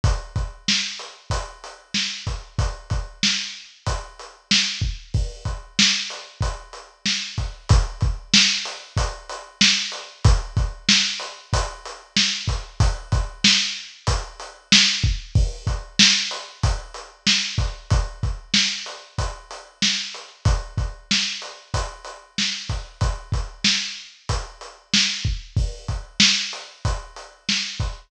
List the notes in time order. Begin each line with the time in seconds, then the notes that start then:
0.04 kick, closed hi-hat
0.36 kick, closed hi-hat
0.68 snare
0.99 closed hi-hat
1.30 kick, closed hi-hat
1.64 closed hi-hat
1.94 snare
2.27 kick, closed hi-hat
2.59 kick, closed hi-hat
2.90 kick, closed hi-hat
3.23 snare
3.86 kick, closed hi-hat
4.19 closed hi-hat
4.51 snare
4.82 kick
5.14 kick, open hi-hat
5.45 kick, closed hi-hat
5.79 snare
6.10 closed hi-hat
6.41 kick, closed hi-hat
6.73 closed hi-hat
7.06 snare
7.38 kick, closed hi-hat
7.69 kick, closed hi-hat
8.01 kick, closed hi-hat
8.34 snare
8.65 closed hi-hat
8.97 kick, closed hi-hat
9.29 closed hi-hat
9.61 snare
9.92 closed hi-hat
10.24 kick, closed hi-hat
10.57 kick, closed hi-hat
10.89 snare
11.20 closed hi-hat
11.53 kick, closed hi-hat
11.85 closed hi-hat
12.16 snare
12.47 kick, closed hi-hat
12.80 kick, closed hi-hat
13.12 kick, closed hi-hat
13.44 snare
14.07 kick, closed hi-hat
14.40 closed hi-hat
14.72 snare
15.04 kick
15.35 kick, open hi-hat
15.67 kick, closed hi-hat
15.99 snare
16.31 closed hi-hat
16.63 kick, closed hi-hat
16.94 closed hi-hat
17.27 snare
17.58 kick, closed hi-hat
17.90 kick, closed hi-hat
18.23 kick, closed hi-hat
18.54 snare
18.86 closed hi-hat
19.18 kick, closed hi-hat
19.51 closed hi-hat
19.82 snare
20.14 closed hi-hat
20.45 kick, closed hi-hat
20.78 kick, closed hi-hat
21.11 snare
21.42 closed hi-hat
21.74 kick, closed hi-hat
22.05 closed hi-hat
22.38 snare
22.69 kick, closed hi-hat
23.01 kick, closed hi-hat
23.32 kick, closed hi-hat
23.64 snare
24.29 kick, closed hi-hat
24.61 closed hi-hat
24.93 snare
25.25 kick
25.57 kick, open hi-hat
25.88 kick, closed hi-hat
26.20 snare
26.53 closed hi-hat
26.85 kick, closed hi-hat
27.16 closed hi-hat
27.49 snare
27.80 kick, closed hi-hat